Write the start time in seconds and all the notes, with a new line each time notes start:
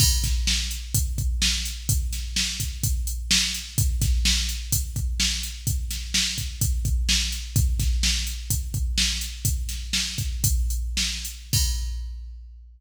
0.00 kick, crash
0.24 kick, snare, closed hi-hat
0.47 snare
0.71 closed hi-hat
0.94 kick, closed hi-hat
1.18 kick, closed hi-hat
1.42 snare
1.65 closed hi-hat
1.89 kick, closed hi-hat
2.13 snare, closed hi-hat
2.36 snare
2.60 kick, closed hi-hat
2.83 kick, closed hi-hat
3.07 closed hi-hat
3.31 snare
3.54 closed hi-hat
3.78 kick, closed hi-hat
4.01 kick, snare, closed hi-hat
4.25 snare
4.49 closed hi-hat
4.72 kick, closed hi-hat
4.96 kick, closed hi-hat
5.20 snare
5.43 closed hi-hat
5.67 kick, closed hi-hat
5.91 snare, closed hi-hat
6.14 snare
6.38 kick, closed hi-hat
6.61 kick, closed hi-hat
6.85 kick, closed hi-hat
7.09 snare
7.32 closed hi-hat
7.56 kick, closed hi-hat
7.80 kick, snare, closed hi-hat
8.03 snare
8.27 closed hi-hat
8.50 kick, closed hi-hat
8.74 kick, closed hi-hat
8.98 snare
9.21 closed hi-hat
9.45 kick, closed hi-hat
9.69 snare, closed hi-hat
9.93 snare
10.18 kick, closed hi-hat
10.44 kick, closed hi-hat
10.70 closed hi-hat
10.97 snare
11.25 closed hi-hat
11.53 kick, crash